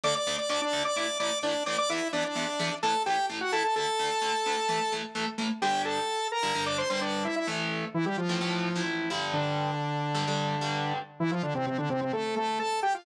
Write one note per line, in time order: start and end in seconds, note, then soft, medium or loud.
0.04 0.13 D2 medium
0.04 0.13 D3 medium
0.04 0.13 A3 medium
0.04 0.15 D5 loud
0.04 0.15 D6 loud
0.15 0.36 D5 medium
0.15 0.36 D6 loud
0.27 0.36 D2 medium
0.27 0.36 D3 medium
0.27 0.36 A3 medium
0.38 0.49 D5 medium
0.38 0.49 D6 medium
0.49 0.59 D2 medium
0.49 0.59 D3 medium
0.49 0.59 A3 medium
0.49 0.61 D5 medium
0.49 0.61 D6 loud
0.61 0.83 D4 medium
0.61 0.83 D5 loud
0.73 0.82 D2 medium
0.73 0.82 D3 medium
0.73 0.82 A3 medium
0.85 0.96 D5 medium
0.85 0.96 D6 loud
0.96 1.06 A2 medium
0.96 1.06 E3 medium
0.96 1.06 A3 medium
0.96 1.18 D5 medium
0.96 1.18 D6 medium
1.20 1.29 A2 medium
1.20 1.29 E3 medium
1.20 1.29 A3 medium
1.20 1.39 D5 medium
1.20 1.39 D6 loud
1.43 1.52 A2 medium
1.43 1.52 E3 medium
1.43 1.52 A3 medium
1.43 1.63 D4 medium
1.43 1.63 D5 loud
1.66 1.75 A2 medium
1.66 1.75 E3 medium
1.66 1.75 A3 medium
1.66 1.77 D5 medium
1.66 1.77 D6 medium
1.78 1.89 D5 loud
1.78 1.89 D6 loud
1.90 1.99 E2 medium
1.90 1.99 E3 medium
1.90 1.99 B3 medium
1.90 2.08 E4 medium
1.90 2.08 E5 loud
2.13 2.22 E2 medium
2.13 2.22 E3 medium
2.13 2.22 B3 medium
2.13 2.24 D4 medium
2.13 2.24 D5 loud
2.25 2.75 D4 medium
2.25 2.75 D5 medium
2.35 2.45 E2 medium
2.35 2.45 E3 medium
2.35 2.45 B3 medium
2.59 2.69 E2 medium
2.59 2.69 E3 medium
2.59 2.69 B3 medium
2.83 2.92 A2 loud
2.83 2.92 E3 medium
2.83 2.92 A3 medium
2.83 3.03 A4 medium
2.83 3.03 A5 loud
3.06 3.16 A2 medium
3.06 3.16 E3 medium
3.06 3.16 A3 medium
3.06 3.26 G4 medium
3.06 3.26 G5 loud
3.30 3.39 A2 medium
3.30 3.39 E3 medium
3.30 3.39 A3 medium
3.41 3.52 F#4 medium
3.41 3.52 F#5 medium
3.52 3.62 A2 medium
3.52 3.62 E3 medium
3.52 3.62 A3 medium
3.52 3.63 A4 loud
3.52 3.63 A5 loud
3.64 3.75 A4 medium
3.64 3.75 A5 loud
3.76 3.85 D2 medium
3.76 3.85 D3 medium
3.76 3.85 A3 medium
3.76 4.93 A4 loud
3.76 4.93 A5 loud
3.99 4.09 D2 medium
3.99 4.09 D3 medium
3.99 4.09 A3 medium
4.22 4.31 D2 medium
4.22 4.31 D3 medium
4.22 4.31 A3 medium
4.46 4.55 D2 medium
4.46 4.55 D3 medium
4.46 4.55 A3 medium
4.69 4.78 A2 medium
4.69 4.78 E3 medium
4.69 4.78 A3 medium
4.92 5.01 A2 medium
4.92 5.01 E3 medium
4.92 5.01 A3 medium
5.15 5.24 A2 medium
5.15 5.24 E3 medium
5.15 5.24 A3 medium
5.38 5.47 A2 medium
5.38 5.47 E3 medium
5.38 5.47 A3 medium
5.62 5.99 G2 medium
5.62 5.99 D3 medium
5.62 5.99 G3 medium
5.62 5.82 G4 medium
5.62 5.82 G5 loud
5.85 6.28 A4 medium
5.85 6.28 A5 medium
6.32 6.65 A#4 medium
6.32 6.65 A#5 medium
6.43 6.52 G2 medium
6.43 6.52 D3 medium
6.43 6.52 G3 medium
6.55 6.83 G2 medium
6.55 6.83 D3 medium
6.55 6.83 G3 medium
6.66 6.77 D5 medium
6.66 6.77 D6 medium
6.78 6.89 C5 medium
6.78 6.89 C6 medium
6.89 7.27 G2 medium
6.89 7.27 D3 medium
6.89 7.27 G3 medium
6.89 7.00 C5 medium
6.89 7.00 C6 medium
7.01 7.24 D4 medium
7.01 7.24 D5 medium
7.25 7.35 E4 medium
7.25 7.35 E5 medium
7.36 7.47 E4 medium
7.36 7.47 E5 medium
7.47 7.84 A2 medium
7.47 7.84 E3 medium
7.47 7.84 A3 medium
7.94 8.05 E3 medium
7.94 8.05 E4 medium
8.06 8.17 G3 medium
8.06 8.17 G4 medium
8.17 8.83 F3 medium
8.17 8.83 F4 medium
8.29 8.38 A2 medium
8.29 8.38 E3 medium
8.29 8.38 A3 medium
8.41 8.69 A2 medium
8.41 8.69 E3 medium
8.41 8.69 A3 medium
8.76 9.09 A2 medium
8.76 9.09 E3 medium
8.76 9.09 A3 medium
9.10 9.71 G2 medium
9.10 9.71 D3 medium
9.10 9.71 G3 medium
9.33 10.93 D3 medium
9.33 10.93 D4 medium
10.15 10.24 G2 medium
10.15 10.24 D3 medium
10.15 10.24 G3 medium
10.27 10.55 G2 medium
10.27 10.55 D3 medium
10.27 10.55 G3 medium
10.61 10.98 G2 medium
10.61 10.98 D3 medium
10.61 10.98 G3 medium
11.20 11.31 E3 medium
11.20 11.31 E4 loud
11.31 11.42 F3 medium
11.31 11.42 F4 medium
11.43 11.54 D3 medium
11.43 11.54 D4 medium
11.55 11.66 C3 medium
11.55 11.66 C4 medium
11.66 11.77 C3 medium
11.66 11.77 C4 medium
11.78 11.89 D3 medium
11.78 11.89 D4 medium
11.90 12.01 C3 medium
11.90 12.01 C4 medium
12.01 12.12 C3 medium
12.01 12.12 C4 medium
12.13 12.35 A3 medium
12.13 12.35 A4 medium
12.36 12.59 A3 medium
12.36 12.59 A4 medium
12.59 12.80 A4 medium
12.59 12.80 A5 medium
12.83 12.94 G4 medium
12.83 12.94 G5 medium
12.94 13.05 F4 medium
12.94 13.05 F5 medium